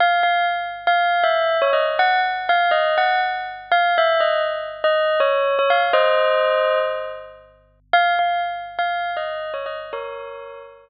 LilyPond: \new Staff { \time 4/4 \key des \major \tempo 4 = 121 f''8 f''8 r8. f''8. e''8. des''16 ees''16 r16 | ges''8 r8 f''8 ees''8 ges''8 r4 f''8 | e''8 ees''8 r8. ees''8. des''8. des''16 f''16 r16 | <c'' ees''>2 r2 |
f''8 f''8 r8. f''8. ees''8. des''16 ees''16 r16 | <bes' des''>4. r2 r8 | }